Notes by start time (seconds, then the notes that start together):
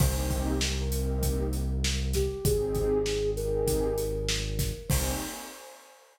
0.00 C2 A#3 C4 D#4 G4 C5, kick, crash
0.18 C5
0.31 kick, closed hi-hat
0.48 G4
0.61 snare
0.80 A#4
0.91 A#3 C4 D#4 G4, closed hi-hat
1.23 kick, closed hi-hat
1.53 closed hi-hat
1.84 snare
2.13 G4, kick, snare, closed hi-hat
2.44 G#1 C4 D#4 G4 G#4, kick, closed hi-hat
2.75 kick, closed hi-hat
3.06 snare
3.36 C4 D#4 G4 G#4 A#4, closed hi-hat
3.67 kick, closed hi-hat
3.98 closed hi-hat
4.29 snare
4.59 kick, snare, closed hi-hat
4.89 C2 A#3 C4 D#4 G4 C5, kick, crash